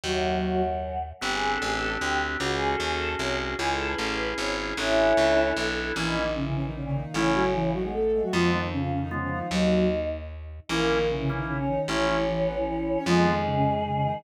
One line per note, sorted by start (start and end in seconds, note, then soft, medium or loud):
0.03 1.13 D#2 loud
0.03 0.35 F#2 medium
0.03 0.35 F#3 medium
0.03 0.61 F#3 medium
0.03 0.61 F#4 medium
0.43 0.98 F#2 medium
0.43 0.98 F#3 medium
1.21 1.58 G1 loud
1.21 2.37 C4 medium
1.21 2.37 D4 medium
1.21 2.37 G4 medium
1.21 1.31 G4 loud
1.32 1.50 G#4 medium
1.51 1.61 A4 medium
1.62 1.97 A1 loud
1.62 1.71 G#4 loud
1.71 1.88 A4 medium
2.01 2.37 D2 medium
2.01 2.18 G4 medium
2.40 2.76 C#2 loud
2.40 3.56 C#4 medium
2.40 3.56 F#4 medium
2.40 2.50 F#4 loud
2.40 3.56 G#4 medium
2.51 2.67 G#4 medium
2.70 2.80 A4 loud
2.80 3.15 D#2 medium
2.80 2.89 G#4 loud
2.90 3.09 A4 loud
3.19 3.55 C2 loud
3.19 3.37 C#5 loud
3.59 3.95 C#2 loud
3.59 4.75 C#4 medium
3.59 4.75 E4 medium
3.59 3.68 G#4 loud
3.59 4.75 G#4 medium
3.69 3.86 A4 medium
3.89 3.98 B4 loud
3.98 4.34 A1 medium
3.98 4.08 A4 medium
4.08 4.25 B4 loud
4.38 4.73 G#1 loud
4.38 4.55 C#5 medium
4.77 5.13 A1 loud
4.77 5.48 C#4 loud
4.77 5.94 D4 medium
4.77 5.48 E4 loud
4.77 5.94 E4 medium
4.77 5.94 A4 medium
5.17 5.53 C#2 medium
5.56 5.92 B1 medium
5.95 7.05 A#1 loud
5.95 6.15 E3 medium
5.95 6.05 E3 medium
5.95 6.24 A#3 medium
5.95 6.24 C#4 medium
5.95 6.15 E4 medium
5.95 6.05 E4 medium
5.95 6.24 E4 medium
6.06 6.31 D#3 medium
6.06 6.31 D#4 medium
6.15 6.33 D#3 medium
6.15 6.33 D#4 medium
6.35 6.44 C#3 medium
6.35 6.68 E3 medium
6.35 6.44 C#4 medium
6.35 6.68 E4 medium
6.46 6.54 C#3 medium
6.46 6.54 C#4 medium
6.55 6.64 C#3 medium
6.55 6.64 C#4 medium
6.65 6.75 D#3 medium
6.65 6.75 D#4 medium
6.74 7.01 A#2 medium
6.74 6.84 C#3 medium
6.74 7.01 A#3 medium
6.74 6.84 C#4 medium
6.85 6.94 C#3 medium
6.85 6.94 C#4 medium
6.94 7.13 D#3 medium
6.94 7.13 D#4 medium
7.04 7.13 A#2 medium
7.04 7.13 A#3 medium
7.14 8.23 A1 loud
7.14 7.70 C#3 medium
7.14 7.31 E3 medium
7.14 7.43 A3 medium
7.14 7.70 C#4 medium
7.14 7.43 C#4 medium
7.14 7.31 E4 medium
7.14 7.43 E4 medium
7.34 7.53 F#3 medium
7.34 7.53 F#4 medium
7.54 7.71 E3 medium
7.54 7.71 E4 medium
7.73 7.83 D#3 medium
7.73 7.82 F#3 medium
7.73 7.83 D#4 medium
7.73 7.82 F#4 medium
7.83 7.93 B2 medium
7.83 7.93 G#3 medium
7.83 7.93 B3 medium
7.83 7.93 G#4 medium
7.93 8.22 A3 medium
7.93 8.22 A4 medium
8.13 8.22 G#2 medium
8.13 8.22 G#3 medium
8.22 8.32 A2 medium
8.22 8.32 F#3 medium
8.22 8.32 A3 medium
8.22 8.32 F#4 medium
8.32 8.68 F2 medium
8.32 9.42 F2 loud
8.32 8.50 F3 medium
8.32 8.68 F3 medium
8.32 8.60 G#3 medium
8.32 8.60 B3 medium
8.32 8.50 F4 medium
8.32 8.60 F4 medium
8.52 8.69 D#3 medium
8.52 8.69 D#4 medium
8.72 8.81 C#3 medium
8.72 8.91 F3 medium
8.72 8.81 C#4 medium
8.72 8.91 F4 medium
8.81 8.91 C#3 medium
8.81 8.91 C#4 medium
8.92 9.01 C#3 medium
8.92 9.01 C#4 medium
9.02 9.11 D#3 medium
9.02 9.11 D#4 medium
9.11 9.20 C#3 medium
9.11 9.48 F3 medium
9.11 9.39 G#3 medium
9.11 9.39 B3 medium
9.11 9.20 C#4 medium
9.11 9.39 F4 medium
9.11 9.48 F4 medium
9.22 9.31 C#3 medium
9.22 9.31 C#4 medium
9.32 9.48 D#3 medium
9.32 9.48 D#4 medium
9.51 10.60 D#2 loud
9.51 9.87 F#3 medium
9.51 10.06 D#4 medium
9.51 9.87 F#4 medium
9.51 10.06 D#5 medium
10.69 11.78 A#1 loud
10.69 10.86 E3 medium
10.69 11.07 A#3 medium
10.69 10.98 A#3 medium
10.69 10.98 C#4 medium
10.69 10.86 E4 medium
10.69 10.98 E4 medium
10.69 11.07 A#4 medium
10.89 11.07 D#3 medium
10.89 11.07 D#4 medium
11.09 11.18 C#3 medium
11.09 11.42 E3 medium
11.09 11.18 C#4 medium
11.09 11.42 E4 medium
11.19 11.29 C#3 medium
11.19 11.29 C#4 medium
11.29 11.39 C#3 medium
11.29 11.57 A#3 medium
11.29 11.39 C#4 medium
11.29 11.57 C#4 medium
11.29 11.57 E4 medium
11.38 11.48 D#3 medium
11.38 11.48 D#4 medium
11.48 11.58 C#3 medium
11.48 11.58 C#4 medium
11.48 11.80 C#4 medium
11.48 11.80 C#5 medium
11.59 11.68 C#3 medium
11.59 11.68 C#4 medium
11.68 11.86 D#3 medium
11.68 11.86 D#4 medium
11.88 12.97 A1 medium
11.88 12.06 E3 medium
11.88 12.17 A3 medium
11.88 13.01 C#4 medium
11.88 12.17 C#4 medium
11.88 12.06 E4 medium
11.88 12.17 E4 medium
11.88 13.01 C#5 medium
12.07 12.24 E3 medium
12.07 12.24 E4 medium
12.28 12.46 E3 medium
12.28 12.46 E4 medium
12.46 12.56 B3 medium
12.46 12.56 B4 medium
12.57 12.66 E3 medium
12.57 12.66 E4 medium
12.67 12.96 E3 medium
12.67 12.96 E4 medium
12.97 13.06 C#4 medium
12.97 13.06 C#5 medium
13.06 14.15 F2 medium
13.06 13.25 F3 medium
13.06 14.19 G#3 medium
13.06 13.34 G#3 medium
13.06 13.34 B3 medium
13.06 13.25 F4 medium
13.06 13.34 F4 medium
13.06 14.19 G#4 medium
13.25 13.44 D#3 medium
13.25 13.44 D#4 medium
13.45 13.55 C#3 medium
13.45 13.55 C#4 medium
13.56 13.65 C#3 medium
13.56 13.65 C#4 medium
13.65 13.75 C#3 medium
13.65 13.75 C#4 medium
13.75 13.85 D#3 medium
13.75 13.85 D#4 medium
13.85 13.94 C#3 medium
13.85 13.94 C#4 medium
13.94 14.04 C#3 medium
13.94 14.04 C#4 medium
14.05 14.22 D#3 medium
14.05 14.22 D#4 medium